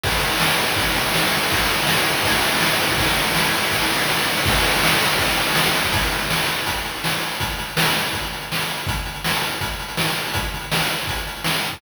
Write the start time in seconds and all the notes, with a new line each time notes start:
0.04 kick, crash
0.12 ride
0.24 ride
0.32 ride
0.40 snare
0.50 ride
0.59 ride
0.68 ride
0.76 kick, ride
0.87 ride
0.96 ride
1.06 ride
1.14 snare
1.23 ride
1.31 ride
1.42 ride
1.50 kick, ride
1.60 ride
1.70 ride
1.79 ride
1.87 snare
1.96 ride
2.08 ride
2.15 ride
2.23 kick, ride
2.33 ride
2.44 ride
2.51 ride
2.61 snare
2.71 ride
2.81 ride
2.89 kick, ride
2.98 kick, ride
3.07 ride
3.17 ride
3.26 ride
3.35 snare
3.45 ride
3.55 ride
3.64 ride
3.71 kick, ride
3.82 ride
3.90 ride
3.99 ride
4.08 snare
4.17 ride
4.28 ride
4.37 ride
4.46 kick, ride
4.55 ride
4.64 ride
4.72 ride
4.84 snare
4.92 ride
5.01 ride
5.10 ride
5.19 kick, ride
5.29 ride
5.38 ride
5.47 ride
5.55 snare
5.65 ride
5.75 ride
5.82 kick, ride
5.92 kick, closed hi-hat
6.03 closed hi-hat
6.12 closed hi-hat
6.20 closed hi-hat
6.30 snare
6.38 closed hi-hat
6.47 closed hi-hat
6.57 closed hi-hat
6.66 kick, closed hi-hat
6.74 closed hi-hat
6.84 closed hi-hat
6.95 closed hi-hat
7.04 snare
7.13 closed hi-hat
7.21 closed hi-hat
7.31 closed hi-hat
7.40 kick, closed hi-hat
7.50 closed hi-hat
7.59 closed hi-hat
7.68 closed hi-hat
7.77 snare
7.85 closed hi-hat
7.94 closed hi-hat
8.04 closed hi-hat
8.13 kick, closed hi-hat
8.22 closed hi-hat
8.33 closed hi-hat
8.41 closed hi-hat
8.52 snare
8.60 closed hi-hat
8.68 closed hi-hat
8.78 closed hi-hat
8.87 kick, closed hi-hat
8.97 closed hi-hat
9.05 closed hi-hat
9.14 closed hi-hat
9.24 snare
9.34 closed hi-hat
9.42 closed hi-hat
9.51 closed hi-hat
9.61 kick, closed hi-hat
9.71 closed hi-hat
9.80 closed hi-hat
9.88 closed hi-hat
9.97 snare
10.07 closed hi-hat
10.16 closed hi-hat
10.25 closed hi-hat
10.34 kick, closed hi-hat
10.43 closed hi-hat
10.54 closed hi-hat
10.62 closed hi-hat
10.72 snare
10.81 closed hi-hat
10.90 closed hi-hat
11.00 closed hi-hat
11.07 kick, closed hi-hat
11.16 closed hi-hat
11.27 closed hi-hat
11.36 closed hi-hat
11.44 snare
11.54 closed hi-hat
11.63 closed hi-hat
11.73 kick, closed hi-hat